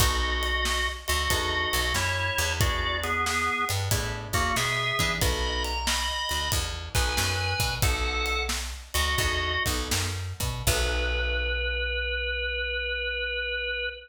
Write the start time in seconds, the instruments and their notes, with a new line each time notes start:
0.00 electric bass (finger) B1, acoustic guitar (steel) B3 D#4 F#4 A4, drawbar organ F#4 D#5, kick, ride
0.43 ride
0.65 snare
1.08 electric bass (finger) D2, drawbar organ F#4 D#5, ride
1.30 electric bass (finger) E2, acoustic guitar (steel) B3 D#4 F#4 A4, kick, ride
1.73 electric bass (finger) B1, ride
1.94 electric bass (finger) F#2, drawbar organ E4 C#5, snare
2.38 electric bass (finger) E2, ride
2.61 acoustic guitar (steel) B3 D4 E4 G#4, drawbar organ F#4 D5, kick, ride
3.04 drawbar organ B3 G#4, ride
3.26 drawbar organ B3 G#4, snare
3.69 electric bass (finger) G2, ride
3.91 electric bass (finger) A2, acoustic guitar (steel) B3 D4 E4 G#4, kick, ride
4.33 electric bass (finger) E2, drawbar organ A#3 F#4, kick, ride
4.56 electric bass (finger) B2, drawbar organ G#4 E5, snare
4.99 electric bass (finger) E3, acoustic guitar (steel) B3 D4 E4 G#4, kick, ride
5.21 electric bass (finger) B1, acoustic guitar (steel) B3 D#4 F#4 A4, drawbar organ D#5 B5, kick, ride
5.64 drawbar organ A#5, ride
5.87 drawbar organ D#5 B5, snare
6.29 electric bass (finger) D2, ride
6.52 electric bass (finger) E2, kick, ride
6.95 electric bass (finger) B1, acoustic guitar (steel) B3 D#4 F#4 A4, drawbar organ B4 G#5, kick, ride
7.17 electric bass (finger) F#2, snare
7.60 electric bass (finger) B2, kick, ride
7.82 electric bass (finger) B1, acoustic guitar (steel) B3 D#4 F#4 A4, drawbar organ A4 F#5, kick, ride
8.26 ride
8.49 snare
8.94 electric bass (finger) D2, drawbar organ F#4 D#5, ride
9.18 electric bass (finger) E2, acoustic guitar (steel) B3 D#4 F#4 A4, kick, ride
9.66 electric bass (finger) B1, acoustic guitar (steel) B3 D#4 F#4 A4, kick, ride
9.91 electric bass (finger) F#2, snare
10.40 electric bass (finger) B2, kick, ride
10.67 electric bass (finger) B1, acoustic guitar (steel) B3 D#4 F#4 A4, drawbar organ B4, kick, crash